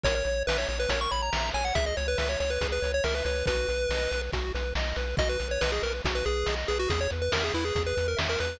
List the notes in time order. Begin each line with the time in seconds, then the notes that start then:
0.03 A#1 A#4 C#5, kick, closed hi-hat
0.15 C#5
0.25 A#1 C#5, closed hi-hat
0.47 A#1 B4 E5, snare
0.58 C#5
0.67 A#1 C#5, closed hi-hat
0.80 B4
0.89 A#1 A#4 C#5, kick, closed hi-hat
1.01 C#6
1.11 A#1 C#5 B5, closed hi-hat
1.22 A#5
1.33 A#1 E5, snare
1.54 A#1 C#5 G#5, closed hi-hat
1.65 F#5
1.75 C#2 G#4 E5, kick, closed hi-hat
1.86 D#5
1.97 C#2 C#5, closed hi-hat
2.08 B4
2.18 C#2 B4 E5, snare
2.29 C#5
2.40 C#2 C#5, closed hi-hat
2.50 B4
2.61 C#2 G#4, kick, closed hi-hat
2.72 B4
2.82 C#2 C#5, closed hi-hat
2.94 C#5
3.04 C#2 A#4 E5, snare
3.15 B4
3.25 C#2 B4 C#5, closed hi-hat
3.46 B1 F#4 B4, kick, closed hi-hat
3.68 B1 B4, closed hi-hat
3.89 B1 D#5, snare
4.12 B1 B4, closed hi-hat
4.33 B1 F#4, kick, closed hi-hat
4.55 B1 B4, closed hi-hat
4.75 B1 D#5, snare
4.96 B1 B4, closed hi-hat
5.17 B1 F#4 D#5, kick, closed hi-hat
5.29 B4
5.40 B1 B4, closed hi-hat
5.51 C#5
5.61 B1 B4 D#5, snare
5.72 G#4
5.83 B1 A#4 B4, closed hi-hat
6.05 B1 F#4, kick, closed hi-hat
6.15 B4
6.25 B1 G#4 B4, closed hi-hat
6.46 B1 D#5, snare
6.68 B1 G#4 B4, closed hi-hat
6.79 F#4
6.88 E2 G#4, kick, closed hi-hat
7.01 C#5
7.10 E2 B4, closed hi-hat
7.22 B4
7.32 E2 A#4 E5, snare
7.44 G#4
7.54 E2 E4 B4, closed hi-hat
7.65 G#4
7.75 E2 G#4, kick, closed hi-hat
7.86 B4
7.96 E2 B4, closed hi-hat
8.08 A#4
8.17 E2 E5, snare
8.29 A#4
8.40 E2 B4, closed hi-hat